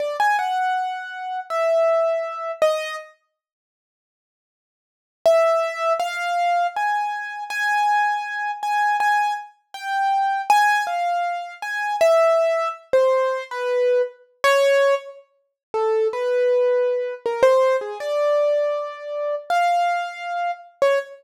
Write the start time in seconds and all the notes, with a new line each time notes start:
0.00 D5
0.20 G#5
0.39 F#5
1.50 E5
2.62 D#5
5.26 E5
6.00 F5
6.76 G#5
7.50 G#5
8.63 G#5
9.00 G#5
9.74 G5
10.50 G#5
10.87 F5
11.62 G#5
12.01 E5
12.93 C5
13.51 B4
14.44 C#5
15.74 A4
16.13 B4
17.26 A#4
17.43 C5
17.81 G#4
18.00 D5
19.50 F5
20.82 C#5